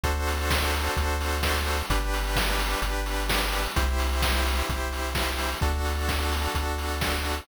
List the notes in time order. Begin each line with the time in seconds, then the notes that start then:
0.03 D2 D4 F#4 A4 C5, kick, closed hi-hat
0.27 open hi-hat
0.50 kick, snare
0.74 open hi-hat
0.96 D2, kick, closed hi-hat
1.21 open hi-hat
1.43 kick, snare
1.67 open hi-hat
1.90 G1 D4 G4 B4, kick, closed hi-hat
2.14 open hi-hat
2.36 kick, snare
2.59 open hi-hat
2.82 G1, kick, closed hi-hat
3.06 open hi-hat
3.29 kick, snare
3.52 open hi-hat
3.76 C2 E4 G4 C5, kick, closed hi-hat
3.99 open hi-hat
4.22 kick, snare
4.45 open hi-hat
4.69 C2, kick, closed hi-hat
4.93 open hi-hat
5.15 kick, snare
5.38 open hi-hat
5.61 D2 D4 F#4 A4, kick, closed hi-hat
5.85 open hi-hat
6.09 kick, snare
6.32 open hi-hat
6.54 D2, kick, closed hi-hat
6.78 open hi-hat
7.01 kick, snare
7.25 open hi-hat